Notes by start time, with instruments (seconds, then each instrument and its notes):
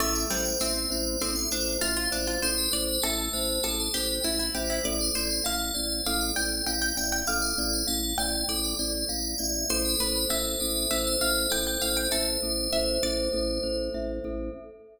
0.00 drawbar organ A1, pizzicato strings A3, glockenspiel A4, tubular bells E5
0.15 tubular bells D5
0.30 drawbar organ A1, pizzicato strings G3, glockenspiel C5, tubular bells E5
0.45 tubular bells D5
0.60 drawbar organ A1, pizzicato strings C4, tubular bells C5, glockenspiel E5
0.90 drawbar organ A1, glockenspiel C5, tubular bells D5
1.20 drawbar organ A1, pizzicato strings C4, glockenspiel A4, tubular bells C5
1.36 tubular bells E5
1.51 drawbar organ A1, pizzicato strings D4, glockenspiel C5, tubular bells D5
1.81 drawbar organ A1, pizzicato strings F4, tubular bells C5, glockenspiel E5
1.97 pizzicato strings F4
2.12 drawbar organ A1, pizzicato strings D4, glockenspiel C5, tubular bells D5
2.27 pizzicato strings F4
2.42 drawbar organ A1, glockenspiel A4, pizzicato strings C5, tubular bells C5
2.58 tubular bells B4
2.71 drawbar organ A1, tubular bells C5, glockenspiel C5, pizzicato strings D5
2.88 tubular bells B4
3.02 drawbar organ A1, tubular bells A4, pizzicato strings A4, glockenspiel E5
3.33 drawbar organ A1, tubular bells B4, glockenspiel C5
3.63 drawbar organ A1, tubular bells A4, pizzicato strings A4, glockenspiel A4
3.80 tubular bells C5
3.94 drawbar organ A1, pizzicato strings G4, tubular bells B4, glockenspiel C5
4.23 drawbar organ A1, pizzicato strings E4, tubular bells C5, glockenspiel E5
4.39 pizzicato strings E4
4.55 drawbar organ A1, pizzicato strings G4, glockenspiel C5, tubular bells D5
4.70 pizzicato strings E4
4.84 drawbar organ A1, glockenspiel A4, tubular bells D5, pizzicato strings D5
5.01 tubular bells C5
5.15 drawbar organ A1, pizzicato strings C5, tubular bells D5, glockenspiel D5
5.30 tubular bells C5
5.44 drawbar organ A1, tubular bells A4, glockenspiel F5, pizzicato strings F5
5.74 drawbar organ A1, tubular bells C5, glockenspiel D5
6.05 drawbar organ A1, glockenspiel A4, tubular bells B4, pizzicato strings F5
6.21 tubular bells D5
6.35 drawbar organ A1, tubular bells C5, glockenspiel D5, pizzicato strings G5
6.67 drawbar organ A1, tubular bells D5, glockenspiel F5, pizzicato strings G5
6.82 pizzicato strings G5
6.97 drawbar organ A1, glockenspiel D5, tubular bells E5, pizzicato strings G5
7.12 pizzicato strings G5
7.27 drawbar organ A1, glockenspiel A4, tubular bells D5, pizzicato strings F5
7.42 tubular bells C5
7.58 drawbar organ A1, tubular bells D5, glockenspiel D5
7.73 tubular bells C5
7.87 drawbar organ A1, tubular bells A4, glockenspiel F5
8.18 drawbar organ A1, tubular bells C5, glockenspiel D5, pizzicato strings G5
8.48 drawbar organ A1, glockenspiel A4, tubular bells B4, pizzicato strings D5
8.64 tubular bells D5
8.79 drawbar organ A1, tubular bells C5, glockenspiel D5
9.09 drawbar organ A1, tubular bells D5, glockenspiel F5
9.38 drawbar organ A1, glockenspiel D5, tubular bells E5
9.69 drawbar organ A1, glockenspiel A4, tubular bells C5, pizzicato strings C5
9.85 tubular bells B4
9.98 drawbar organ A1, pizzicato strings B4, tubular bells C5, glockenspiel C5
10.16 tubular bells B4
10.29 drawbar organ A1, tubular bells A4, glockenspiel E5, pizzicato strings E5
10.60 drawbar organ A1, glockenspiel A4, tubular bells B4
10.91 drawbar organ A1, tubular bells A4, glockenspiel C5, pizzicato strings E5
11.07 tubular bells C5
11.21 drawbar organ A1, tubular bells B4, glockenspiel E5, pizzicato strings F5
11.50 drawbar organ A1, tubular bells A4, glockenspiel A4, pizzicato strings G5
11.67 pizzicato strings G5
11.81 drawbar organ A1, tubular bells B4, glockenspiel C5, pizzicato strings F5
11.97 pizzicato strings G5
12.11 drawbar organ A1, pizzicato strings A4, tubular bells C5, glockenspiel E5
12.42 drawbar organ A1, glockenspiel A4
12.73 drawbar organ A1, glockenspiel C5, pizzicato strings E5
13.03 drawbar organ A1, pizzicato strings D5, glockenspiel E5
13.33 drawbar organ A1, glockenspiel A4
13.63 drawbar organ A1, glockenspiel C5
13.94 drawbar organ A1, glockenspiel E5
14.24 drawbar organ A1, glockenspiel A4